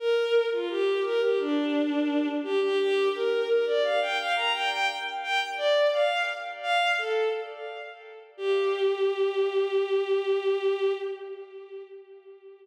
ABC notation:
X:1
M:4/4
L:1/16
Q:1/4=86
K:Gm
V:1 name="Violin"
B3 F G2 B G D6 G G | G2 B2 B d f g f b g g z2 g z | d2 f2 z2 f2 A2 z6 | G16 |]